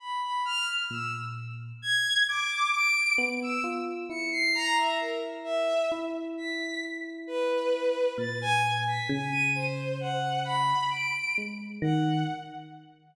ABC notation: X:1
M:9/8
L:1/16
Q:3/8=44
K:none
V:1 name="Violin"
b b f' z e' z3 _a'2 d'2 d''2 z e' z2 | _d'' c'' _b e _B z e2 z2 =b'2 z2 =B4 | a' _a z b' a _e'' c2 _g2 b2 d''2 z2 g2 |]
V:2 name="Electric Piano 1"
z4 _B,,4 z6 =B,2 F2 | E8 E10 | _B,,4 _D,8 z2 _A,2 _E,2 |]